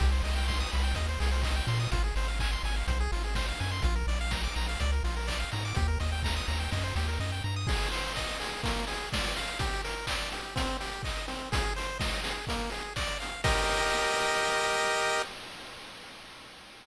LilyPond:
<<
  \new Staff \with { instrumentName = "Lead 1 (square)" } { \time 4/4 \key c \minor \tempo 4 = 125 g'16 c''16 ees''16 g''16 c'''16 ees'''16 b''16 g''16 ees''16 c''16 aes'16 c''16 ees''16 g''16 c'''16 ees'''16 | f'16 aes'16 c''16 f''16 aes''16 c'''16 aes''16 f''16 c''16 aes'16 f'16 aes'16 c''16 f''16 aes''16 c'''16 | f'16 bes'16 d''16 f''16 bes''16 d'''16 bes''16 f''16 d''16 bes'16 f'16 bes'16 d''16 f''16 bes''16 d'''16 | g'16 bes'16 ees''16 g''16 bes''16 ees'''16 bes''16 g''16 ees''16 c''16 g'16 bes'16 ees''16 g''16 bes''16 ees'''16 |
\key ees \major aes'8 c''8 ees''8 aes'8 bes8 aes'8 d''8 f''8 | g'8 bes'8 d''8 g'8 c'8 g'8 ees''8 c'8 | aes'8 c''8 ees''8 aes'8 bes8 aes'8 d''8 f''8 | <g' bes' ees''>1 | }
  \new Staff \with { instrumentName = "Synth Bass 1" } { \clef bass \time 4/4 \key c \minor c,8 c,4 c,8 ees,8 c,4 bes,8 | aes,,8 aes,,4 aes,,8 b,,8 aes,,4 ges,8 | bes,,8 bes,,4 bes,,8 des,8 bes,,4 aes,8 | ees,8 ees,4 ees,8 ges,8 ees,8 ges,8 g,8 |
\key ees \major r1 | r1 | r1 | r1 | }
  \new DrumStaff \with { instrumentName = "Drums" } \drummode { \time 4/4 <cymc bd>8 hho8 <bd sn>8 hho8 <hh bd>8 hho8 <hc bd>8 hho8 | <hh bd>8 hho8 <hc bd>8 hho8 <hh bd>8 hho8 <bd sn>8 hho8 | <hh bd>8 hho8 <bd sn>8 hho8 <hh bd>8 hho8 <hc bd>8 hho8 | <hh bd>8 hho8 <bd sn>8 hho8 <bd sn>8 sn8 sn4 |
<cymc bd>16 hh16 hho16 hh16 <hc bd>16 hh16 hho16 hh16 <hh bd>16 hh16 hho16 hh16 <bd sn>16 hh16 hho16 hh16 | <hh bd>16 hh16 hho16 hh16 <hc bd>16 hh16 hho16 hh16 <hh bd>16 hh16 hho16 hh16 <hc bd>16 hh16 hho16 hh16 | <hh bd>16 hh16 hho16 hh16 <bd sn>16 hh16 hho16 hh16 <hh bd>16 hh16 hho16 hh16 <hc bd>16 hh16 hho16 hh16 | <cymc bd>4 r4 r4 r4 | }
>>